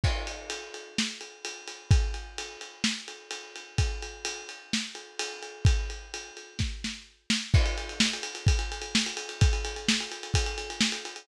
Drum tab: CC |x---------------|----------------|----------------|----------------|
RD |--x-x-x---x-x-x-|x-x-x-x---x-x-x-|x-x-x-x---x-x-x-|x-x-x-x---------|
SD |--------o-------|--------o-------|--------o-------|--------o-o---o-|
BD |o---------------|o---------------|o---------------|o-------o-------|

CC |x---------------|----------------|
RD |-xxx-xxxxxxx-xxx|xxxx-xxxxxxx-xxx|
SD |----o-------o---|----o-------o---|
BD |o-------o-------|o-------o-------|